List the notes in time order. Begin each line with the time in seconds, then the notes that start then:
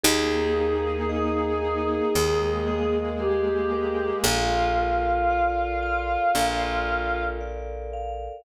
0.04 D#2 A#3 D#4 G#4
0.56 A#4
1.09 D#5
1.62 G#4
2.14 D#2 G#3 A#3 G#4 A#4
2.67 D#5
3.19 G4 G#4
3.72 A#4
4.24 A#1 F4 A4
4.78 A#4
5.30 D5
5.82 F5
6.35 A#1 A4
6.88 A#4
7.41 D5
7.93 F5